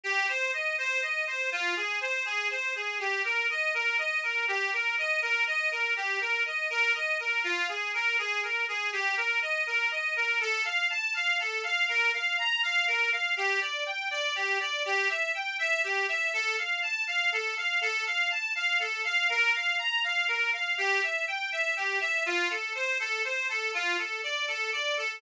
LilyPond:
\new Staff { \time 6/8 \key ees \major \tempo 4. = 81 g'8 c''8 ees''8 c''8 ees''8 c''8 | f'8 aes'8 c''8 aes'8 c''8 aes'8 | g'8 bes'8 ees''8 bes'8 ees''8 bes'8 | g'8 bes'8 ees''8 bes'8 ees''8 bes'8 |
g'8 bes'8 ees''8 bes'8 ees''8 bes'8 | f'8 aes'8 bes'8 aes'8 bes'8 aes'8 | g'8 bes'8 ees''8 bes'8 ees''8 bes'8 | \key f \major a'8 f''8 a''8 f''8 a'8 f''8 |
bes'8 f''8 bes''8 f''8 bes'8 f''8 | g'8 d''8 g''8 d''8 g'8 d''8 | g'8 e''8 g''8 e''8 g'8 e''8 | a'8 f''8 a''8 f''8 a'8 f''8 |
a'8 f''8 a''8 f''8 a'8 f''8 | bes'8 f''8 bes''8 f''8 bes'8 f''8 | g'8 e''8 g''8 e''8 g'8 e''8 | f'8 a'8 c''8 a'8 c''8 a'8 |
f'8 a'8 d''8 a'8 d''8 a'8 | }